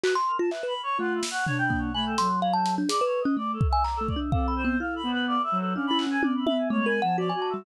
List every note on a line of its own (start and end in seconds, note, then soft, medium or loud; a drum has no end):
0.03 0.14 F#4 loud
0.03 0.14 B4 medium
0.03 clap medium
0.15 0.37 C6 loud
0.27 0.38 A#4 medium
0.39 0.50 F4 loud
0.39 0.50 A5 soft
0.51 0.66 B4 medium
0.51 0.62 E5 medium
0.51 clap medium
0.63 0.74 B4 medium
0.63 0.81 B5 medium
0.83 0.97 C#5 medium
0.98 1.21 A3 medium
0.98 1.20 F4 loud
0.98 1.13 F#5 loud
1.15 1.29 E5 soft
1.23 snare medium
1.31 1.45 F#5 loud
1.47 1.90 D4 medium
1.47 1.57 C#5 loud
1.47 floor tom medium
1.58 1.80 G5 loud
1.70 1.92 A#3 medium
1.70 kick medium
1.94 2.15 A3 medium
1.94 2.16 G#5 medium
1.94 2.05 B5 loud
2.06 2.28 A4 medium
2.18 2.83 F#3 medium
2.18 2.40 C6 loud
2.18 closed hi-hat medium
2.42 2.53 F5 loud
2.53 2.75 A5 loud
2.66 closed hi-hat medium
2.78 2.89 D4 loud
2.89 3.00 G#4 medium
2.89 3.04 D5 medium
2.89 closed hi-hat loud
3.01 3.23 B4 loud
3.05 3.20 C#5 medium
3.21 3.35 D#5 medium
3.25 3.36 C#4 loud
3.37 3.58 A3 medium
3.37 3.51 D5 medium
3.53 3.67 A4 medium
3.61 kick loud
3.69 3.83 E5 loud
3.69 3.83 G#5 loud
3.84 3.99 A#5 medium
3.84 clap medium
3.96 4.07 A4 medium
4.01 4.15 A3 medium
4.08 4.19 D5 medium
4.08 kick medium
4.16 4.31 D4 medium
4.32 4.75 C4 medium
4.32 4.54 A4 medium
4.32 4.46 F5 medium
4.32 kick medium
4.48 4.62 B5 medium
4.56 4.77 C5 medium
4.65 4.79 B3 loud
4.80 5.02 E4 medium
4.80 4.94 F5 medium
4.96 5.10 B5 medium
5.03 5.36 B3 loud
5.12 5.26 B4 loud
5.27 5.42 D5 loud
5.43 5.58 E5 loud
5.52 5.73 F#3 loud
5.59 5.73 A4 medium
5.74 6.17 C#4 medium
5.74 5.90 D4 medium
5.74 5.86 F5 medium
5.87 6.05 E4 medium
5.87 5.98 B5 loud
5.99 6.10 F#5 medium
5.99 clap medium
6.07 6.21 C#4 medium
6.07 6.21 G#5 loud
6.23 6.44 C#4 medium
6.23 6.33 D5 medium
6.23 high tom loud
6.46 6.68 E5 medium
6.46 6.57 B5 medium
6.46 high tom loud
6.70 7.00 G#3 medium
6.70 6.85 A3 loud
6.70 6.85 C#5 medium
6.86 7.00 A#4 loud
6.86 7.00 G#5 medium
7.02 7.31 F3 medium
7.02 7.16 F#5 loud
7.02 7.16 A5 medium
7.18 7.29 F#4 medium
7.18 7.32 D5 loud
7.29 7.40 G#5 medium
7.34 7.63 F#4 medium
7.34 7.48 D5 medium
7.42 7.53 A5 medium
7.50 7.64 G3 medium
7.50 7.64 E5 medium